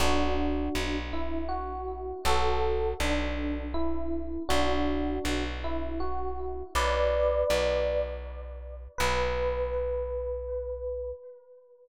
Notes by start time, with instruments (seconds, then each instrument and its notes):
0.00 electric bass (finger) B1, electric piano 1 D4 F#4
0.75 electric bass (finger) B1
1.13 electric piano 1 E4
1.49 electric piano 1 F#4
2.25 electric bass (finger) B1, electric piano 1 F#4 A4
3.00 electric bass (finger) B1, electric piano 1 D4
3.74 electric piano 1 E4
4.49 electric bass (finger) B1, electric piano 1 D4 F#4
5.25 electric bass (finger) B1
5.64 electric piano 1 E4
6.00 electric piano 1 F#4
6.75 electric bass (finger) B1, electric piano 1 B4 D5
7.50 electric bass (finger) B1
8.98 electric bass (finger) B1, electric piano 1 B4